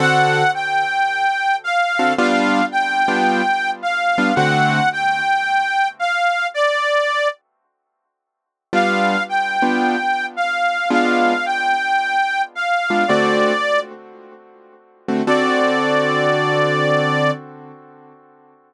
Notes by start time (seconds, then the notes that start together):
0.00 D3 C4 F#4 A4 F#5
0.54 G5
1.64 F5
1.99 D3 C4 F#4 A4
2.18 G3 B3 D4 F4 F5
2.72 G5
3.08 G3 B3 D4 F4
3.83 F5
4.18 G3 B3 D4 F4
4.35 D3 A3 C4 F#4 F#5
4.93 G5
5.99 F5
6.54 D5
8.73 G3 B3 D4 F4 F5
9.29 G5
9.62 G3 B3 D4 F4
10.36 F5
10.90 G#3 B3 D4 F4 F5
11.46 G5
12.55 F5
12.90 G#3 B3 D4 F4
13.08 D3 A3 C4 F#4 D5
15.08 D3 A3 C4 F#4
15.27 D3 C4 F#4 A4 D5